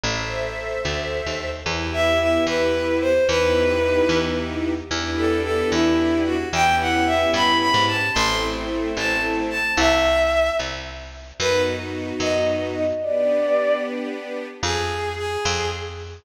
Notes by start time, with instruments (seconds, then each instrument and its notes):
0.03 electric bass (finger) A1, string ensemble 1 A4 C5 E5
0.85 electric bass (finger) D2
1.26 electric bass (finger) D#2
1.66 electric bass (finger) E2, string ensemble 1 B3 E4 G4
1.93 violin E5
2.20 violin E5
2.47 electric bass (finger) E2, violin B4
3.01 violin C5
3.27 electric bass (finger) E2, string ensemble 1 B3 D#4 E4 G4, violin B4
4.09 electric bass (finger) E2
4.90 electric bass (finger) E2, string ensemble 1 B3 D4 E4 G4
5.17 violin A4
5.43 violin A4
5.72 electric bass (finger) E2, violin E4
6.26 violin F#4
6.52 electric bass (finger) E2, string ensemble 1 B3 C#4 E4 G4, violin G5
6.80 violin F#5
7.06 violin E5
7.34 electric bass (finger) G2, violin B5
7.61 violin B5
7.74 electric bass (finger) G#2
7.87 violin A5
8.14 electric bass (finger) A1, string ensemble 1 A3 C4 E4, violin C6
8.97 electric bass (finger) A1, violin A5
9.50 violin A5
9.77 electric bass (finger) C2, violin E5
10.59 electric bass (finger) C2
11.39 electric bass (finger) F#2, string ensemble 1 B3 D#4 F#4, violin B4
12.20 electric bass (finger) F#2, violin D#5
12.74 violin D#5
13.01 string ensemble 1 B3 D4 G4, violin D5
14.63 electric bass (finger) F2, violin G#4
15.17 violin G#4
15.45 electric bass (finger) F2